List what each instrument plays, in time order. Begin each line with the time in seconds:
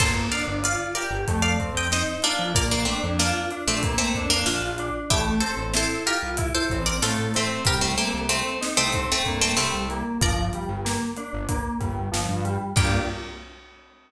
0.00 synth bass 1 G1, electric piano 2 A#3, pizzicato strings A4 C5, kick, crash
0.32 electric piano 2 D4, pizzicato strings D5 F5, closed hi-hat
0.47 synth bass 1 G1
0.63 electric piano 2 F4, pizzicato strings D5 F5, closed hi-hat
0.95 electric piano 2 G4, pizzicato strings A#4 D5, closed hi-hat
1.11 synth bass 1 G1
1.28 synth bass 1 F2, electric piano 2 A3, kick, closed hi-hat
1.42 pizzicato strings D5 F5
1.59 electric piano 2 C4, kick, closed hi-hat
1.74 synth bass 1 F2, pizzicato strings D#5 G5
1.91 electric piano 2 D#4, pizzicato strings C5 D#5, snare
2.22 pizzicato strings A#3 D4, electric piano 2 F4, closed hi-hat
2.39 synth bass 1 F2
2.54 synth bass 1 A#1, electric piano 2 A#3, pizzicato strings A#4 D5, kick, closed hi-hat
2.71 pizzicato strings A#3 D4
2.85 pizzicato strings A3 C4, electric piano 2 D4, closed hi-hat
3.03 synth bass 1 F2
3.19 pizzicato strings A#3 D4, electric piano 2 F4, snare
3.51 electric piano 2 D4, closed hi-hat
3.67 synth bass 1 A#1, pizzicato strings A3 C4
3.83 electric piano 2 A#3, kick, closed hi-hat
3.98 pizzicato strings A3 C4
4.14 synth bass 1 F2, electric piano 2 D4, kick, closed hi-hat
4.30 pizzicato strings A#3 D4
4.46 synth bass 1 A#1, pizzicato strings D4 F4, electric piano 2 F4, snare
4.61 synth bass 1 A#1
4.78 electric piano 2 D4, closed hi-hat
5.10 synth bass 1 A1, electric piano 2 A3, pizzicato strings E4 G4, kick, closed hi-hat
5.40 electric piano 2 C4, pizzicato strings A4 C5, closed hi-hat
5.57 synth bass 1 A1
5.74 electric piano 2 E4, pizzicato strings A4 C5, snare
6.06 electric piano 2 F4, pizzicato strings G4 A#4, closed hi-hat
6.23 synth bass 1 C2
6.37 electric piano 2 E4, kick, closed hi-hat
6.55 pizzicato strings A4 C5
6.70 synth bass 1 A1, electric piano 2 C4, kick, closed hi-hat
6.86 pizzicato strings A#4 D5
7.02 synth bass 1 A2, electric piano 2 A3, pizzicato strings F4 A4, snare
7.19 synth bass 1 A1
7.34 pizzicato strings A3 C4, electric piano 2 C4, closed hi-hat
7.65 synth bass 1 C2, electric piano 2 G3, pizzicato strings G4 A#4, kick, closed hi-hat
7.81 pizzicato strings A3 C4
7.97 pizzicato strings A3 C4, electric piano 2 A#3, closed hi-hat
8.14 synth bass 1 C2
8.29 pizzicato strings A3 C4, electric piano 2 C4, closed hi-hat
8.61 electric piano 2 D#4, snare
8.77 synth bass 1 C2, pizzicato strings A3 C4
8.92 electric piano 2 C4, kick, closed hi-hat
9.12 pizzicato strings A3 C4
9.25 synth bass 1 G2, electric piano 2 A#3, kick, closed hi-hat
9.41 pizzicato strings A3 C4
9.57 synth bass 1 C2, electric piano 2 G3, pizzicato strings A3 C4, snare
9.74 synth bass 1 C2
9.90 electric piano 2 A#3, closed hi-hat
10.21 synth bass 1 G1, electric piano 2 F3, pizzicato strings A#4 D5, kick, closed hi-hat
10.53 electric piano 2 G3, closed hi-hat
10.69 synth bass 1 G1
10.85 electric piano 2 A#3, snare
11.16 electric piano 2 D4, closed hi-hat
11.33 synth bass 1 G1
11.49 electric piano 2 A#3, kick, closed hi-hat
11.80 synth bass 1 G1, electric piano 2 G3, kick, closed hi-hat
12.12 synth bass 1 G1, electric piano 2 F3, snare
12.29 synth bass 1 G2
12.45 electric piano 2 G3, closed hi-hat
12.76 synth bass 1 G2, electric piano 2 A#3 D4 F4 G4, pizzicato strings G5, kick, crash